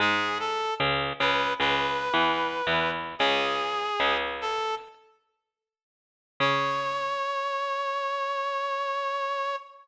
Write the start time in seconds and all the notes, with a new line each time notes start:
0.00 G#2 G#3 G#4
0.40 A4
0.80 C#2 C#3
1.20 C#2 C#3 B4
1.60 C#2 C#3 B4
2.14 E2 E3
2.67 E2 E3
3.19 C#2 C#3 G#4
4.00 C#2 C#3
4.41 A4
6.40 C#3 C#5